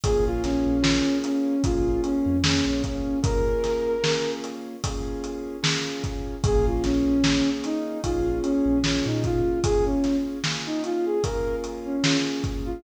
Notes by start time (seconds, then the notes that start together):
0.04 A#1 A#3 C#4 F4 G#4, kick, closed hi-hat
0.26 A#1 F4
0.44 A#1 C#4, snare, closed hi-hat
0.66 A#1
0.83 A#3 C#4 F4 G#4, snare
1.24 C#4, closed hi-hat
1.64 A#1 A#3 C#4 F4 G#4, kick, closed hi-hat
2.04 C#4, closed hi-hat
2.26 F2
2.44 A#3 C#4 F4 G#4, snare
2.66 A#1 C#4
2.84 C#4, kick, closed hi-hat
3.23 A#3 C#4 F4 G#4 A#4, kick, closed hi-hat
3.64 snare, closed hi-hat
4.03 A#3 C#4 F4 G#4, snare
4.44 closed hi-hat
4.84 A#3 C#4 F4 G#4, kick, closed hi-hat
5.24 closed hi-hat
5.63 A#3 C#4 F4 G#4, snare
6.04 kick, closed hi-hat
6.44 A#1 A#3 C#4 F4 G#4, kick, closed hi-hat
6.66 A#1 F4
6.84 A#1 C#4, snare, closed hi-hat
7.06 A#1
7.24 A#3 C#4 F4 G#4, snare
7.64 D#4, snare, closed hi-hat
8.03 A#1 A#3 C#4 F4 G#4, kick, closed hi-hat
8.43 C#4, closed hi-hat
8.66 A#1
8.84 A#3 C#4 F4 G#4, snare
9.06 A#2 D#4
9.24 F4, kick, closed hi-hat
9.64 A#3 C#4 F4 G#4, kick, closed hi-hat
9.86 C#4
10.04 snare, closed hi-hat
10.44 A#3 C#4 F4 G#4, snare
10.66 D#4
10.84 F4, closed hi-hat
11.06 G#4
11.23 A#3 C#4 F4 G#4 A#4, kick, closed hi-hat
11.64 closed hi-hat
11.85 C#4
12.04 A#3 C#4 F4 G#4, snare
12.44 kick, closed hi-hat
12.65 F4